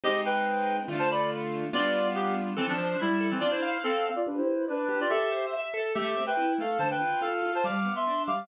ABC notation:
X:1
M:2/4
L:1/16
Q:1/4=142
K:C
V:1 name="Clarinet"
[G_e]2 [Bg]6 | z [ca] [db]2 z4 | [Fd]4 [B,G]2 z2 | [K:Am] [E,C] [F,D]3 [G,E]3 [E,C] |
[Fd] [Ec]3 [CA]3 [Fd] | [DB] [Ec]3 [DB]3 [Fd] | [Ge]4 z4 | [Ge]3 [Bg]3 [Af]2 |
[ca] [Bg]3 [Af]3 [ca] | [fd']3 [ec']3 [fd']2 |]
V:2 name="Acoustic Grand Piano"
[_A,C_E]8 | [D,A,F]8 | [G,B,DF]8 | [K:Am] A2 c2 e2 A2 |
D2 f2 f2 f2 | G2 B2 d2 G2 | A2 c2 e2 A2 | A,2 C2 E2 A,2 |
D,2 F2 F2 F2 | G,2 B,2 D2 G,2 |]